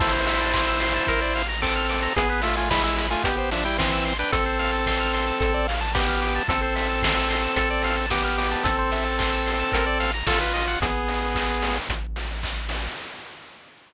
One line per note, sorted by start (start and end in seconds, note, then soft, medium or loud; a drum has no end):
0.00 1.00 A1 medium
0.00 1.43 E4 medium
0.00 0.12 A4 medium
0.00 1.43 C5 medium
0.00 kick loud
0.00 crash loud
0.13 0.25 C5 medium
0.27 0.39 E5 medium
0.27 open hi-hat loud
0.41 0.53 A5 medium
0.54 0.66 C6 medium
0.54 kick loud
0.54 clap loud
0.67 0.80 E6 medium
0.80 0.93 C6 medium
0.80 open hi-hat loud
0.94 1.06 A5 medium
1.07 2.08 A1 medium
1.07 1.20 A#4 medium
1.07 kick loud
1.07 closed hi-hat loud
1.22 1.34 D5 medium
1.35 1.48 F5 medium
1.35 snare medium
1.35 open hi-hat medium
1.49 1.61 A#5 medium
1.62 2.13 C4 medium
1.62 2.13 A4 medium
1.62 1.74 D6 medium
1.62 kick loud
1.62 clap loud
1.76 1.88 F6 medium
1.89 2.01 D6 medium
1.89 open hi-hat medium
2.03 2.15 A#5 medium
2.16 3.16 A1 medium
2.16 2.41 B3 medium
2.16 2.28 G#4 medium
2.16 2.41 G#4 medium
2.16 kick loud
2.16 closed hi-hat loud
2.30 2.42 B4 medium
2.42 2.56 A3 medium
2.42 2.56 F4 medium
2.42 2.55 E5 medium
2.42 open hi-hat loud
2.57 2.70 A3 medium
2.57 2.70 F4 medium
2.57 2.69 G#5 medium
2.70 2.83 G#3 medium
2.70 2.83 E4 medium
2.70 2.82 B5 medium
2.70 kick loud
2.70 snare loud
2.83 3.07 G#3 medium
2.83 3.07 E4 medium
2.83 2.96 E6 medium
2.96 3.09 B5 medium
2.96 open hi-hat medium
3.10 3.24 A3 medium
3.10 3.24 F4 medium
3.10 3.23 G#5 medium
3.24 4.24 A1 medium
3.24 3.50 B3 medium
3.24 3.36 G4 medium
3.24 3.50 G4 medium
3.24 kick loud
3.24 closed hi-hat loud
3.38 3.50 C5 medium
3.51 3.64 F3 medium
3.51 3.64 D4 medium
3.51 3.63 E5 medium
3.51 snare medium
3.51 open hi-hat medium
3.65 3.78 G3 medium
3.65 3.78 E4 medium
3.65 3.77 G5 medium
3.78 4.14 E3 medium
3.78 4.14 C4 medium
3.78 3.91 C6 medium
3.78 kick loud
3.78 snare loud
3.92 4.04 E6 medium
4.05 4.18 C6 medium
4.05 open hi-hat medium
4.19 4.32 D4 medium
4.19 4.32 B4 medium
4.19 4.31 G5 medium
4.32 5.32 A1 medium
4.32 5.67 C4 medium
4.32 4.44 A4 medium
4.32 5.67 A4 medium
4.32 kick loud
4.32 closed hi-hat loud
4.46 4.58 C5 medium
4.59 4.71 F5 medium
4.59 open hi-hat medium
4.73 4.85 A5 medium
4.86 4.99 C6 medium
4.86 kick medium
4.86 snare loud
5.00 5.12 F6 medium
5.13 5.26 C6 medium
5.13 open hi-hat medium
5.27 5.39 A5 medium
5.40 6.40 A1 loud
5.40 5.53 A4 medium
5.40 kick loud
5.40 closed hi-hat loud
5.54 5.66 D5 medium
5.67 5.80 F5 medium
5.67 snare medium
5.67 open hi-hat loud
5.81 5.93 A5 medium
5.95 6.43 B3 medium
5.95 6.43 G4 medium
5.95 6.07 D6 medium
5.95 kick loud
5.95 snare loud
6.08 6.20 F6 medium
6.22 6.34 D6 medium
6.22 open hi-hat medium
6.35 6.48 A5 medium
6.48 7.48 A1 medium
6.48 8.06 C4 medium
6.48 6.61 A4 medium
6.48 8.06 A4 medium
6.48 kick loud
6.48 closed hi-hat loud
6.62 6.74 C5 medium
6.75 6.88 E5 medium
6.75 open hi-hat medium
6.89 7.01 A5 medium
7.02 7.15 C6 medium
7.02 kick loud
7.02 snare loud
7.16 7.28 E6 medium
7.30 7.42 C6 medium
7.30 open hi-hat medium
7.43 7.55 A5 soft
7.56 8.56 A1 medium
7.56 7.69 A4 medium
7.56 kick medium
7.56 closed hi-hat loud
7.70 7.83 D5 medium
7.83 7.96 F5 medium
7.83 snare medium
7.83 open hi-hat medium
7.97 8.09 A5 medium
8.10 8.64 B3 medium
8.10 8.64 G4 medium
8.10 8.23 D6 medium
8.10 kick medium
8.10 snare loud
8.24 8.36 F6 medium
8.38 8.50 D6 medium
8.38 open hi-hat loud
8.51 8.64 A5 medium
8.64 9.64 A1 medium
8.64 10.11 C4 medium
8.64 10.11 A4 medium
8.64 8.77 A4 medium
8.64 kick loud
8.64 closed hi-hat loud
8.78 8.91 C5 medium
8.92 9.04 E5 medium
8.92 open hi-hat medium
9.06 9.18 A5 medium
9.19 9.31 C6 medium
9.19 kick loud
9.19 clap loud
9.32 9.45 E6 medium
9.46 9.58 C6 medium
9.46 open hi-hat medium
9.59 9.72 A5 medium
9.72 10.23 A1 medium
9.72 9.85 A#4 medium
9.72 kick loud
9.72 closed hi-hat loud
9.86 9.99 D5 medium
10.00 10.12 F5 medium
10.00 snare medium
10.00 open hi-hat medium
10.14 10.26 A#5 medium
10.26 10.76 A1 medium
10.26 10.79 F4 medium
10.26 10.39 A4 medium
10.26 kick loud
10.26 snare loud
10.41 10.53 B4 medium
10.54 10.66 D#5 medium
10.54 open hi-hat medium
10.68 10.80 F#5 medium
10.81 11.80 A1 medium
10.81 11.78 B3 medium
10.81 11.78 G#4 medium
10.81 kick loud
10.81 closed hi-hat loud
11.08 open hi-hat medium
11.35 kick loud
11.35 clap loud
11.62 open hi-hat loud
11.89 12.89 A1 medium
11.89 kick loud
11.89 closed hi-hat loud
12.16 snare medium
12.16 open hi-hat medium
12.43 kick medium
12.43 clap loud
12.69 open hi-hat loud